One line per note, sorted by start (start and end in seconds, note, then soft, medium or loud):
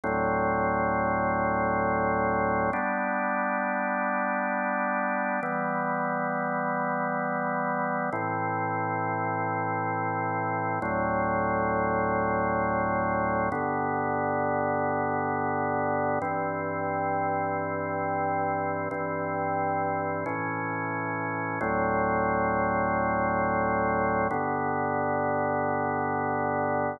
0.04 2.71 D2 medium
0.04 2.71 A2 medium
0.04 2.71 F#3 medium
0.04 2.71 C4 medium
2.73 5.40 G3 medium
2.73 5.40 B3 medium
2.73 5.40 D4 medium
5.43 8.10 E3 medium
5.43 8.10 G3 medium
5.43 8.10 B3 medium
8.12 10.79 A2 medium
8.12 10.79 E3 medium
8.12 10.79 C4 medium
10.82 13.49 D2 medium
10.82 13.49 A2 medium
10.82 13.49 F#3 medium
10.82 13.49 C4 medium
13.52 16.19 G2 medium
13.52 16.19 D3 medium
13.52 16.19 B3 medium
16.22 18.89 G2 medium
16.22 18.89 E3 medium
16.22 18.89 C4 medium
18.91 20.25 G2 medium
18.91 20.25 E3 medium
18.91 20.25 C4 medium
20.26 21.59 A2 medium
20.26 21.59 E3 medium
20.26 21.59 C#4 medium
21.61 24.28 D2 medium
21.61 24.28 A2 medium
21.61 24.28 F#3 medium
21.61 24.28 C4 medium
24.31 26.98 G2 medium
24.31 26.98 D3 medium
24.31 26.98 B3 medium